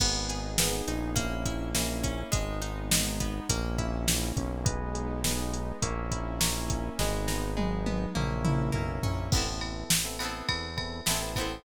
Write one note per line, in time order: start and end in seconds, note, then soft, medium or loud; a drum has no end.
0.00 0.82 G#1 medium
0.00 0.52 B3 medium
0.00 1.15 B3 medium
0.00 0.59 B3 medium
0.00 0.52 D#4 medium
0.00 1.15 D#4 medium
0.00 0.52 G#4 loud
0.00 1.15 G#4 medium
0.00 kick medium
0.00 crash loud
0.29 1.13 G#4 medium
0.29 closed hi-hat medium
0.58 1.10 B3 medium
0.58 1.15 B3 medium
0.58 1.10 D#4 medium
0.58 1.10 G#4 medium
0.58 snare loud
0.87 2.24 A#1 medium
0.87 1.16 D#4 medium
0.87 closed hi-hat medium
1.16 1.74 A#3 loud
1.16 1.69 A#3 loud
1.16 2.32 A#3 medium
1.16 1.69 C#4 loud
1.16 2.32 C#4 medium
1.16 1.69 E4 loud
1.16 2.32 E4 medium
1.16 kick medium
1.16 closed hi-hat medium
1.46 2.29 E4 medium
1.46 kick medium
1.46 closed hi-hat medium
1.75 2.30 A#3 medium
1.75 2.28 A#3 medium
1.75 2.28 C#4 medium
1.75 2.28 E4 medium
1.75 snare medium
2.04 2.31 C#4 medium
2.04 kick medium
2.04 closed hi-hat medium
2.32 3.41 G#1 medium
2.32 2.91 G#3 medium
2.32 3.48 G#3 medium
2.32 3.48 B3 medium
2.32 3.48 D#4 medium
2.32 kick medium
2.32 closed hi-hat medium
2.62 3.45 D#4 medium
2.62 closed hi-hat medium
2.91 3.47 G#3 medium
2.91 snare loud
3.20 3.48 B3 medium
3.20 kick medium
3.20 closed hi-hat medium
3.49 4.33 A#1 loud
3.49 4.07 A#3 medium
3.49 4.65 A#3 medium
3.49 4.65 C#4 medium
3.49 4.65 E4 medium
3.49 kick medium
3.49 closed hi-hat loud
3.78 4.61 E4 medium
3.78 kick medium
3.78 closed hi-hat medium
4.08 4.63 A#3 medium
4.08 snare medium
4.36 5.73 B1 medium
4.36 4.65 C#4 medium
4.36 kick medium
4.36 closed hi-hat medium
4.65 5.81 G#3 medium
4.65 5.24 B3 loud
4.65 5.81 B3 medium
4.65 5.81 D#4 medium
4.65 5.17 G#4 loud
4.65 5.17 B4 loud
4.65 5.17 D#5 medium
4.65 kick loud
4.65 closed hi-hat medium
4.95 5.78 G#4 medium
4.95 closed hi-hat medium
5.24 5.80 B3 medium
5.24 5.77 G#4 medium
5.24 5.77 B4 medium
5.24 5.77 D#5 medium
5.24 snare medium
5.53 5.81 D#4 medium
5.53 closed hi-hat medium
5.82 6.89 A#1 medium
5.82 6.40 A#3 loud
5.82 6.98 A#3 medium
5.82 6.98 C#4 medium
5.82 6.98 E4 medium
5.82 6.35 A#4 loud
5.82 6.35 C#5 loud
5.82 6.35 E5 loud
5.82 kick medium
5.82 closed hi-hat medium
6.11 6.94 E4 medium
6.11 kick medium
6.11 closed hi-hat medium
6.40 6.96 A#3 medium
6.40 6.93 A#4 medium
6.40 6.93 C#5 medium
6.40 6.93 E5 medium
6.40 snare loud
6.68 6.96 C#4 medium
6.68 kick medium
6.68 closed hi-hat medium
6.99 8.06 G#1 loud
6.99 8.14 G#3 medium
6.99 7.56 G#3 loud
6.99 8.14 B3 medium
6.99 8.14 D#4 medium
6.99 7.51 G#4 loud
6.99 7.51 B4 loud
6.99 7.51 D#5 medium
6.99 kick medium
6.99 snare medium
7.28 8.11 D#4 medium
7.28 snare medium
7.57 8.12 G#3 medium
7.57 8.10 G#4 medium
7.57 8.10 B4 medium
7.57 8.10 D#5 medium
7.57 high tom medium
7.86 8.14 B3 medium
7.86 high tom medium
8.15 8.71 A#1 loud
8.15 8.72 A#3 medium
8.15 9.31 A#3 medium
8.15 9.31 C#4 medium
8.15 9.31 E4 medium
8.15 8.69 A#4 loud
8.15 8.69 C#5 loud
8.15 8.69 E5 loud
8.15 mid tom medium
8.45 9.28 E4 medium
8.45 mid tom medium
8.72 9.00 B1 medium
8.72 9.28 A#3 medium
8.72 9.27 A#4 medium
8.72 9.27 C#5 medium
8.72 9.27 E5 medium
8.72 floor tom medium
9.03 9.29 A#1 medium
9.03 9.31 C#4 medium
9.03 floor tom medium
9.31 9.84 A1 medium
9.31 9.44 B3 loud
9.31 10.13 B3 medium
9.31 9.44 C4 medium
9.31 10.13 C4 medium
9.31 9.44 E4 medium
9.31 9.44 A4 loud
9.31 kick loud
9.31 crash medium
9.36 10.13 E4 medium
9.36 10.13 A4 medium
9.46 9.92 B3 medium
9.46 9.92 C4 medium
9.46 9.92 E4 medium
9.46 9.92 A4 medium
9.61 ride medium
9.90 10.42 A1 soft
9.90 snare loud
10.05 10.17 B3 medium
10.05 10.17 C4 medium
10.05 10.17 E4 medium
10.05 10.17 A4 medium
10.19 10.66 B3 medium
10.19 11.01 B3 medium
10.19 10.66 C4 medium
10.19 11.01 C4 medium
10.19 10.66 E4 medium
10.19 10.66 A4 medium
10.19 ride medium
10.23 11.01 E4 medium
10.23 11.01 A4 medium
10.49 11.01 E2 medium
10.49 kick medium
10.49 ride medium
10.77 11.00 B3 medium
10.77 11.00 C4 medium
10.77 11.00 E4 loud
10.77 11.00 A4 medium
10.77 kick medium
10.77 ride medium
11.06 11.59 A1 medium
11.06 11.33 B3 medium
11.06 11.18 B3 medium
11.06 11.18 C4 medium
11.06 11.33 C4 medium
11.06 11.18 E4 medium
11.06 11.33 E4 medium
11.06 11.18 A4 medium
11.06 snare medium
11.11 11.33 A4 medium
11.22 11.57 B3 medium
11.22 11.57 C4 medium
11.22 11.57 E4 medium
11.22 11.57 A4 medium
11.36 11.63 B3 medium
11.36 11.63 C4 medium
11.36 11.63 E4 medium
11.36 kick medium
11.36 ride medium
11.41 11.63 A4 medium